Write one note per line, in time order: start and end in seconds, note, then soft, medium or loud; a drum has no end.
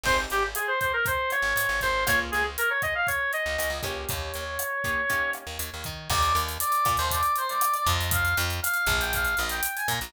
0.04 0.26 G#1 medium
0.04 0.41 C4 medium
0.04 0.41 D#4 medium
0.04 0.41 G4 medium
0.04 0.41 G#4 medium
0.04 0.17 C5 medium
0.04 kick medium
0.04 crash medium
0.30 0.54 G#1 medium
0.30 0.43 G4 medium
0.30 closed hi-hat medium
0.55 0.67 G#4 medium
0.55 cross-stick medium
0.55 closed hi-hat medium
0.68 0.80 C5 medium
0.80 0.92 C5 medium
0.80 kick medium
0.80 closed hi-hat medium
0.93 1.05 A#4 medium
1.06 1.31 C5 medium
1.06 kick medium
1.06 closed hi-hat medium
1.30 1.81 C#5 medium
1.30 cross-stick medium
1.30 closed hi-hat medium
1.42 1.54 G#1 medium
1.56 1.67 G#2 medium
1.56 closed hi-hat medium
1.69 1.80 G#1 medium
1.81 2.05 G#1 medium
1.81 2.04 C5 medium
1.81 kick medium
1.81 closed hi-hat medium
2.07 2.31 C#2 medium
2.07 2.42 A#3 medium
2.07 2.42 C#4 medium
2.07 2.42 F4 medium
2.07 2.42 G#4 medium
2.07 2.20 C#5 medium
2.07 kick medium
2.07 cross-stick medium
2.07 closed hi-hat medium
2.32 2.57 C#2 medium
2.32 2.44 G#4 medium
2.32 closed hi-hat medium
2.58 2.70 A#4 medium
2.58 closed hi-hat medium
2.70 2.82 C#5 medium
2.82 2.94 D#5 medium
2.82 kick medium
2.82 cross-stick medium
2.82 closed hi-hat medium
2.95 3.07 F5 medium
3.07 3.32 C#5 medium
3.07 kick medium
3.07 closed hi-hat medium
3.33 3.79 D#5 medium
3.33 closed hi-hat medium
3.46 3.57 C#2 medium
3.58 3.69 C#2 medium
3.58 cross-stick medium
3.58 closed hi-hat medium
3.70 3.81 C#2 medium
3.83 4.05 C#2 medium
3.83 4.44 A#3 medium
3.83 4.44 C#4 medium
3.83 4.44 D#4 medium
3.83 4.44 G4 medium
3.83 4.05 C#5 medium
3.83 kick medium
3.83 closed hi-hat medium
4.09 4.32 D#2 medium
4.09 5.31 C#5 medium
4.09 kick medium
4.09 closed hi-hat medium
4.34 4.58 D#2 medium
4.34 closed hi-hat medium
4.59 cross-stick medium
4.59 closed hi-hat medium
4.84 5.02 A#3 medium
4.84 5.02 C#4 medium
4.84 5.02 D#4 medium
4.84 5.02 G4 medium
4.84 kick medium
4.84 closed hi-hat medium
5.10 5.45 A#3 medium
5.10 5.45 C#4 medium
5.10 5.45 D#4 medium
5.10 5.45 G4 medium
5.10 kick medium
5.10 closed hi-hat medium
5.33 cross-stick medium
5.33 closed hi-hat soft
5.47 5.58 D#2 medium
5.59 5.70 D#2 medium
5.59 closed hi-hat medium
5.74 5.85 D#2 medium
5.84 6.09 D#3 medium
5.84 kick medium
5.84 closed hi-hat medium
6.10 6.33 D#2 loud
6.10 6.35 D5 medium
6.10 kick medium
6.10 cross-stick medium
6.10 crash medium
6.22 closed hi-hat medium
6.35 6.58 D#2 medium
6.35 closed hi-hat medium
6.49 closed hi-hat medium
6.60 6.92 D5 medium
6.60 closed hi-hat medium
6.72 closed hi-hat medium
6.85 6.97 A#2 medium
6.85 kick medium
6.85 cross-stick medium
6.85 closed hi-hat medium
6.97 7.21 D#2 loud
6.97 7.10 C5 medium
6.97 closed hi-hat medium
7.11 7.32 D5 medium
7.11 kick medium
7.11 closed hi-hat medium
7.23 closed hi-hat medium
7.36 7.49 C5 medium
7.36 closed hi-hat medium
7.49 7.73 D5 medium
7.49 closed hi-hat medium
7.61 cross-stick medium
7.61 closed hi-hat medium
7.74 7.86 D5 medium
7.74 closed hi-hat medium
7.87 8.34 F2 loud
7.87 8.09 D#5 medium
7.87 kick medium
7.87 closed hi-hat medium
8.01 closed hi-hat medium
8.11 8.35 F5 medium
8.11 kick medium
8.11 closed hi-hat loud
8.25 closed hi-hat medium
8.37 8.60 F2 loud
8.37 closed hi-hat medium
8.50 closed hi-hat medium
8.62 8.93 F5 medium
8.62 cross-stick medium
8.62 closed hi-hat medium
8.74 closed hi-hat medium
8.87 9.35 A#1 loud
8.87 kick medium
8.87 closed hi-hat medium
9.01 9.13 G5 medium
9.01 closed hi-hat medium
9.13 9.36 F5 medium
9.13 kick medium
9.13 closed hi-hat medium
9.25 closed hi-hat medium
9.37 9.61 A#1 medium
9.37 9.51 D#5 medium
9.37 cross-stick medium
9.37 closed hi-hat medium
9.49 9.71 G5 medium
9.49 closed hi-hat medium
9.63 closed hi-hat loud
9.76 9.88 G#5 medium
9.76 closed hi-hat medium
9.88 10.00 A#2 loud
9.88 10.10 A#5 medium
9.88 kick medium
9.88 closed hi-hat medium
10.01 10.13 A#1 medium
10.01 closed hi-hat medium